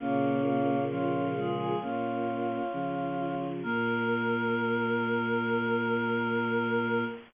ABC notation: X:1
M:4/4
L:1/16
Q:1/4=66
K:Bbm
V:1 name="Choir Aahs"
F2 F2 F3 A F8 | B16 |]
V:2 name="Choir Aahs"
[B,D]4 [DF]2 [FA]2 [DF]8 | B16 |]
V:3 name="Choir Aahs"
[B,D]4 [D,F,]2 [F,A,]2 [B,D]4 [D,F,]4 | B,16 |]
V:4 name="Choir Aahs" clef=bass
[B,,D,]8 B,,4 z4 | B,,16 |]